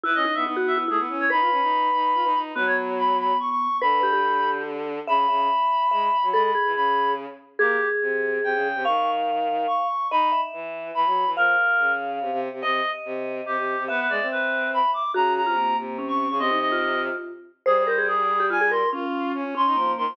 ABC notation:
X:1
M:3/4
L:1/16
Q:1/4=143
K:Bmix
V:1 name="Clarinet"
B d2 e z2 e z G z2 c | b12 | B c z2 b2 b2 c' c'3 | b8 z4 |
b12 | b b3 b4 z4 | [K:Abmix] =G3 z5 =g4 | d'3 z5 d'4 |
_c'3 z5 c'4 | B6 z6 | e3 z5 =G4 | =B B =d2 B4 =b2 =d'2 |
b2 b4 z3 d'2 d' | e2 e4 z6 | A A c2 A4 a2 c'2 | z6 c'4 c'2 |]
V:2 name="Vibraphone"
E2 D2 D F2 E E4 | B10 z2 | B,12 | B2 =G G5 z4 |
e z e e5 e3 z | A2 G6 z4 | [K:Abmix] A12 | f12 |
e2 _f8 z2 | f12 | e12 | =e12 |
G3 F B,4 D4 | C E2 F5 z4 | c2 B A z3 =G F A B2 | D6 D2 B, B,3 |]
V:3 name="Violin"
E C z B, B,4 A, B, C2 | D ^E C D3 D2 E D D2 | F,8 z4 | =D,12 |
C,2 C,2 z4 G,2 z F, | G,2 z E, C,6 z2 | [K:Abmix] B,2 z2 C,4 C, D,2 C, | E,8 z4 |
E2 z2 _F,4 F, G,2 F, | F,2 z2 D,4 C, C,2 C, | C,2 z2 C,4 C, C,2 C, | =B,2 A, C7 z2 |
D,3 C,3 C,5 D, | C,8 z4 | =G,12 | F4 D2 D E F,2 E, F, |]